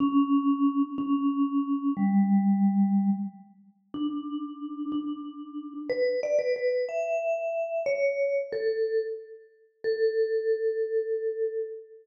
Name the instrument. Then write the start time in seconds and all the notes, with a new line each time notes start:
vibraphone
0.00 C#4
0.98 C#4
1.97 G3
3.94 D4
4.92 D4
5.89 B4
6.23 D5
6.39 B4
6.56 B4
6.89 E5
7.86 C#5
8.52 A4
9.84 A4